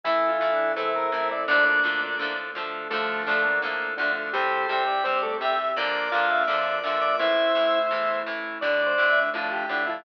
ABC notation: X:1
M:4/4
L:1/8
Q:1/4=168
K:Dm
V:1 name="Drawbar Organ"
[E,E]4 [C,C]2 [C,C] [C,C] | [Dd] [Dd]2 [Dd]2 z3 | [A,A]2 [D,D]2 z2 [D,D] z | [G,G]2 [Gg]2 [Cc] [A,A] [Gg] z |
[dd']2 [Ff]2 [dd']3 [dd'] | [Ee]4 z4 | [Dd]4 [F,F]2 [D,D] [F,F] |]
V:2 name="Lead 1 (square)"
(3E2 F2 D2 A B2 d | [B,D]5 z3 | [F,A,]3 B,3 D2 | [Ac]3 d3 e2 |
[Bd]3 e3 e2 | [ce]7 z | (3d2 c2 e2 A G2 E |]
V:3 name="Acoustic Guitar (steel)"
[E,A,]2 [E,A,]2 [E,A,]2 [E,A,]2 | [D,F,A,]2 [D,F,A,]2 [D,F,A,]2 [D,F,A,]2 | [D,F,A,]2 [D,F,A,]2 [D,F,A,]2 [D,F,A,]2 | [C,G,]2 [C,G,]2 [C,G,]2 [C,G,]2 |
[B,,D,F,]2 [B,,D,F,]2 [B,,D,F,]2 [B,,D,F,]2 | [A,,E,]2 [A,,E,]2 [A,,E,]2 [A,,E,]2 | [A,,D,]2 [A,,D,]2 [A,,D,]2 [A,,D,]2 |]
V:4 name="Drawbar Organ"
[EA]2 [EA]2 [EA]2 [EA]2 | [DFA]2 [DFA]2 [DFA]2 [DFA]2 | [DFA]2 [DFA]2 [DFA]2 [DFA]2 | [CG]2 [CG]2 [CG]2 [CG]2 |
[B,DF]2 [B,DF]2 [B,DF]2 [B,DF]2 | [A,E]2 [A,E]2 [A,E]2 [A,E]2 | [A,D]2 [A,D]2 [A,D]2 [A,D]2 |]
V:5 name="Synth Bass 1" clef=bass
A,,,2 A,,,2 E,,2 A,,,2 | D,,2 D,,2 A,,2 D,,2 | D,,2 D,,2 A,,2 D,,2 | C,,2 C,,2 G,,2 C,,2 |
B,,,2 B,,,2 F,,2 B,,,2 | A,,,2 A,,,2 E,,2 A,,,2 | D,,2 D,,2 A,,2 D,,2 |]
V:6 name="Pad 5 (bowed)"
[EA]8 | [DFA]4 [A,DA]4 | [DFA]4 [A,DA]4 | [CG]8 |
[B,DF]4 [B,FB]4 | [A,E]8 | [A,D]8 |]